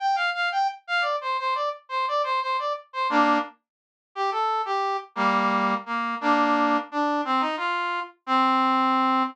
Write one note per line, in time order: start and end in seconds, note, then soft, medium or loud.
0.00 0.16 G5 medium
0.16 0.30 F5 medium
0.34 0.49 F5 medium
0.52 0.67 G5 medium
0.87 1.03 F5 medium
1.01 1.16 D5 medium
1.21 1.37 C5 medium
1.39 1.54 C5 medium
1.55 1.69 D5 medium
1.89 2.06 C5 medium
2.08 2.22 D5 medium
2.24 2.40 C5 medium
2.41 2.57 C5 medium
2.59 2.73 D5 medium
2.93 3.08 C5 medium
3.10 3.38 A#3 medium
3.10 3.38 D4 loud
4.15 4.30 G4 medium
4.31 4.62 A4 medium
4.65 4.97 G4 medium
5.15 5.74 G3 medium
5.15 5.74 A#3 medium
5.86 6.15 A#3 medium
6.21 6.77 A#3 medium
6.21 6.77 D4 medium
6.92 7.21 D4 medium
7.25 7.42 C4 medium
7.40 7.56 D#4 medium
7.57 8.00 F4 medium
8.26 9.23 C4 loud